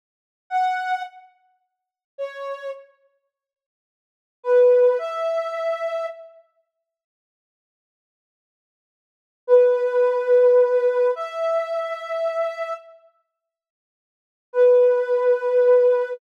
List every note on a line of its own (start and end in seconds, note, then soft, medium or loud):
0.50 1.02 F#5 medium
2.18 2.70 C#5 medium
4.43 4.98 B4 medium
4.99 6.06 E5 medium
9.47 11.11 B4 medium
11.16 12.74 E5 medium
14.53 16.13 B4 medium